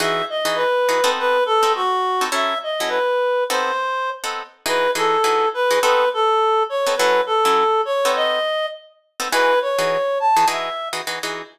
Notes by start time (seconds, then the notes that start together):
0.00 E3 D#4 F#4 G#4 E5
0.30 D#5
0.45 E3 D#4 F#4 G#4
0.55 B4
0.89 E3 D#4 F#4 G#4
1.04 B3 C4 D#4 A4
1.19 B4
1.46 A4
1.63 B3 C4 D#4 A4
1.75 F#4
2.21 B3 C4 D#4 A4
2.32 F#3 C#4 E4 A4 E5
2.63 D#5
2.80 F#3 C#4 E4 A4
2.88 B4
3.49 B3 C4 D#4 A4 C5
4.24 B3 C4 D#4 A4
4.66 E3 D#4 F#4 G#4 B4
4.95 E3 D#4 F#4 G#4 A4
5.24 E3 D#4 F#4 G#4
5.54 B4
5.71 E3 D#4 F#4 G#4
5.81 B3 C4 D#4 A4 B4
6.14 A4
6.69 C#5
6.87 B3 C4 D#4 A4
6.97 F#3 C#4 E4 A4 B4
7.26 A4
7.45 F#3 C#4 E4 A4
7.85 C#5
8.05 B3 C4 D#4 A4
8.16 D#5
9.20 B3 C4 D#4 A4
9.31 E3 D#4 F#4 G#4 B4
9.62 C#5
9.79 E3 D#4 F#4 G#4
10.20 A5
10.37 E3 D#4 F#4 G#4
10.48 E3 D#4 F#4 G#4 E5
10.93 E3 D#4 F#4 G#4
11.07 E3 D#4 F#4 G#4
11.23 E3 D#4 F#4 G#4